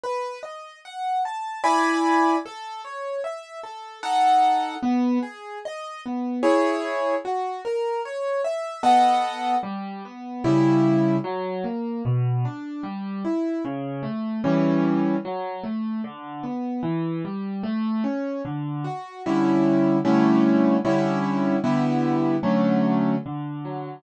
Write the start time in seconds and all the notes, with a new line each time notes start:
0.04 B4
0.43 D#5
0.85 F#5
1.25 A5
1.64 E4 D5 G#5 B5
2.46 A4
2.85 C#5
3.24 E5
3.63 A4
4.03 D#4 A4 F#5
4.83 B3
5.23 G#4
5.65 D#5
6.06 B3
6.43 E4 G#4 C#5
7.25 F#4
7.65 A#4
8.05 C#5
8.44 E5
8.83 B3 A4 D#5 F#5
9.63 G3
10.05 B3
10.44 C#3 G3 E4
11.24 F#3
11.64 A#3
12.05 B2
12.45 D4
12.83 G3
13.25 E4
13.65 C#3
14.03 A3
14.44 E3 G3 C#4
15.25 F#3
15.64 A3
16.04 D3
16.43 B3
16.83 E3
17.25 G3
17.63 A3
18.04 C#4
18.45 D3
18.84 F#4
19.26 D3 G3 C#4 E4
20.05 D3 G3 A3 C#4 E4
20.85 D3 G3 C#4 E4
21.64 D3 G3 B3 E4
22.43 D3 F#3 A3 C#4
23.26 D3
23.65 F#3